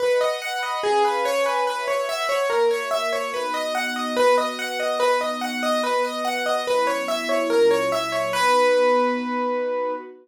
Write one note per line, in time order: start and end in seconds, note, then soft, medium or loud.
0.00 0.19 B4 medium
0.00 0.41 B4 medium
0.00 0.42 D#5 medium
0.00 0.41 F#5 medium
0.21 0.40 D#5 medium
0.41 0.83 B4 medium
0.41 0.83 F#5 medium
0.41 0.61 F#5 medium
0.41 0.83 B5 medium
0.63 0.82 D#5 medium
0.83 1.25 C#4 medium
0.83 1.03 G#4 medium
0.83 1.25 B4 medium
0.83 1.25 F5 medium
0.83 1.25 G#5 medium
1.05 1.24 B4 medium
1.25 1.67 C#4 medium
1.25 1.65 B4 loud
1.25 1.44 C#5 medium
1.25 1.65 C#5 medium
1.25 1.67 G#5 medium
1.46 1.65 B4 medium
1.66 2.07 F#4 medium
1.66 2.07 B4 medium
1.66 1.86 B4 medium
1.66 2.07 C#5 medium
1.66 2.07 E5 medium
1.88 2.07 C#5 medium
2.08 2.50 F#4 medium
2.08 2.50 B4 medium
2.08 2.50 E5 medium
2.08 2.28 E5 medium
2.08 2.50 F#5 loud
2.29 2.48 C#5 medium
2.50 2.91 A#3 loud
2.50 2.91 F#4 medium
2.50 2.69 A#4 medium
2.50 2.91 C#5 medium
2.50 2.91 E5 medium
2.71 2.90 C#5 medium
2.91 3.33 A#3 loud
2.91 3.32 F#4 medium
2.91 3.33 A#4 medium
2.91 3.10 E5 medium
2.91 3.33 E5 medium
3.13 3.32 C#5 medium
3.33 4.15 B3 medium
3.33 4.15 D#4 medium
3.33 4.15 F#4 medium
3.33 3.53 B4 medium
3.54 3.73 D#5 medium
3.75 3.94 F#5 medium
3.96 4.15 D#5 medium
4.16 4.99 B3 medium
4.16 4.99 F#4 medium
4.16 4.36 B4 medium
4.16 4.99 B4 medium
4.38 4.57 D#5 medium
4.59 4.78 F#5 medium
4.80 4.99 D#5 medium
5.00 5.82 B3 medium
5.00 5.82 D#4 medium
5.00 5.82 F#4 medium
5.00 5.19 B4 medium
5.21 5.40 D#5 medium
5.41 5.61 F#5 medium
5.63 5.82 D#5 medium
5.83 6.66 B3 medium
5.83 6.66 F#4 medium
5.83 6.66 B4 medium
5.83 6.03 B4 medium
6.05 6.24 D#5 medium
6.25 6.44 F#5 medium
6.46 6.65 D#5 medium
6.66 7.08 F#3 medium
6.66 7.08 B3 medium
6.66 7.08 C#4 medium
6.66 7.08 E4 medium
6.66 6.86 B4 medium
6.87 7.06 C#5 medium
7.08 7.50 F#3 medium
7.08 7.51 B3 medium
7.08 7.50 E4 loud
7.08 7.51 F#4 medium
7.08 7.27 E5 medium
7.29 7.48 C#5 medium
7.50 7.91 A#2 medium
7.50 7.91 F#3 medium
7.50 7.92 C#4 medium
7.50 7.91 E4 medium
7.50 7.69 A#4 medium
7.71 7.90 C#5 medium
7.92 8.33 A#2 medium
7.92 8.33 F#3 medium
7.92 8.33 A#3 medium
7.92 8.33 E4 medium
7.92 8.11 E5 medium
8.12 8.31 C#5 medium
8.33 9.93 B3 loud
8.33 9.93 D#4 loud
8.33 9.93 F#4 loud
8.33 9.93 B4 loud